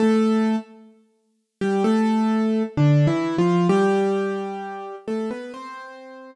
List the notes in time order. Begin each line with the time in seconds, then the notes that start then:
0.00 A3 A4
1.61 G3 G4
1.84 A3 A4
2.77 D3 D4
3.07 E3 E4
3.38 F3 F4
3.69 G3 G4
5.08 A3 A4
5.31 B3 B4
5.54 C4 C5